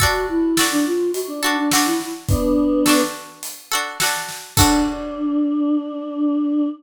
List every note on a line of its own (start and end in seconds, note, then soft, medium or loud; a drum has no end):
0.00 0.52 D4 loud
0.00 0.26 F#4 loud
0.00 0.52 F#4 loud
0.00 0.52 A4 medium
0.00 kick medium
0.00 closed hi-hat medium
0.29 0.66 E4 medium
0.57 1.36 D4 medium
0.57 1.36 F#4 medium
0.57 1.36 A4 medium
0.57 snare medium
0.71 0.85 D4 loud
0.86 1.11 F4 medium
1.14 1.27 F#4 medium
1.14 closed hi-hat medium
1.28 1.41 D4 medium
1.42 1.56 D4 loud
1.42 1.69 D4 medium
1.42 1.69 F#4 medium
1.42 1.69 A4 medium
1.57 1.70 D4 medium
1.71 1.86 D4 medium
1.71 2.77 D4 medium
1.71 2.77 F#4 medium
1.71 2.77 A4 medium
1.71 snare loud
1.85 2.09 E4 medium
2.00 snare soft
2.29 3.02 B3 medium
2.29 3.02 D4 loud
2.29 kick loud
2.29 closed hi-hat medium
2.86 3.65 D4 medium
2.86 3.65 F#4 medium
2.86 3.65 A4 medium
2.86 snare medium
3.43 closed hi-hat loud
3.72 3.98 D4 medium
3.72 3.98 F#4 medium
3.72 3.98 A4 medium
4.00 4.53 D4 medium
4.00 4.53 F#4 medium
4.00 4.53 A4 medium
4.00 snare medium
4.29 snare medium
4.57 6.67 D4 loud
4.57 6.68 D4 medium
4.57 6.68 F#4 loud
4.57 6.68 A4 loud
4.57 kick loud
4.57 crash loud